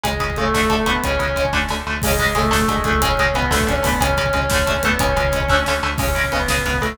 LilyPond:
<<
  \new Staff \with { instrumentName = "Distortion Guitar" } { \time 6/8 \key cis \phrygian \tempo 4. = 121 <gis gis'>4 <a a'>8 <a a'>8 <a a'>8 <b b'>8 | <cis' cis''>4. r4. | <gis gis'>4 <a a'>8 <a a'>8 <gis gis'>8 <a a'>8 | <cis' cis''>4 <b b'>8 <a a'>8 <cis' cis''>8 <b b'>8 |
<cis' cis''>4 <cis' cis''>4. <b b'>8 | <cis' cis''>2~ <cis' cis''>8 r8 | <cis' cis''>4 <b b'>4. <a a'>8 | }
  \new Staff \with { instrumentName = "Overdriven Guitar" } { \time 6/8 \key cis \phrygian <cis gis>8 <cis gis>8 <cis gis>8 <d a>8 <d a>8 <d a>8 | <cis gis>8 <cis gis>8 <cis gis>8 <d a>8 <d a>8 <d a>8 | <cis gis>8 <cis gis>8 <cis gis>8 <d a>8 <d a>8 <d a>8 | <cis gis>8 <cis gis>8 <cis gis>8 <d a>8 <d a>8 <d a>8 |
<cis gis>8 <cis gis>8 <cis gis>8 <d a>8 <d a>8 <d a>8 | <cis gis>8 <cis gis>8 <cis gis>8 <d a>8 <d a>8 <d a>8 | <cis gis>8 <cis gis>8 <cis gis>8 <cis gis>8 <cis gis>8 <cis gis>8 | }
  \new Staff \with { instrumentName = "Synth Bass 1" } { \clef bass \time 6/8 \key cis \phrygian cis,8 cis,8 cis,8 d,8 d,8 d,8 | cis,8 cis,8 cis,8 d,8 d,8 d,8 | cis,8 cis,8 cis,8 d,8 d,8 cis,8~ | cis,8 cis,8 cis,8 d,8 d,8 d,8 |
cis,8 cis,8 cis,8 d,8 d,8 d,8 | cis,8 cis,8 cis,8 d,8 d,8 d,8 | cis,8 cis,8 cis,8 cis,8 cis,8 cis,8 | }
  \new DrumStaff \with { instrumentName = "Drums" } \drummode { \time 6/8 <hh bd>16 bd16 <hh bd>16 bd16 <hh bd>16 bd16 <bd sn>16 bd16 <hh bd>16 bd16 <hh bd>16 bd16 | <hh bd>16 bd16 <hh bd>16 bd16 <hh bd>16 bd16 <bd sn>8 sn4 | <cymc bd>16 bd16 <hh bd>16 bd16 <hh bd>16 bd16 <bd sn>16 bd16 <hh bd>16 bd16 <hh bd>16 bd16 | <hh bd>16 bd16 <hh bd>16 bd16 <hh bd>16 bd16 <bd sn>16 bd16 <hh bd>16 bd16 <hho bd>16 bd16 |
<hh bd>16 bd16 <hh bd>16 bd16 <hh bd>16 bd16 <bd sn>16 bd16 <hh bd>16 bd16 <hh bd>16 bd16 | <hh bd>16 bd16 <hh bd>16 bd16 <hh bd>16 bd16 <bd sn>8 sn4 | <cymc bd>16 bd16 <bd cymr>16 bd16 <bd cymr>16 bd16 <bd sn>16 bd16 <bd cymr>16 bd16 <bd cymr>16 bd16 | }
>>